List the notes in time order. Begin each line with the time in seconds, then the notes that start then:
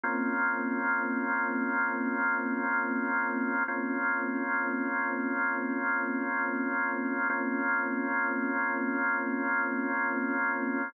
0.04 A#3 C4 C#4 F4
3.68 A#3 C4 C#4 F4
7.30 A#3 C4 C#4 F4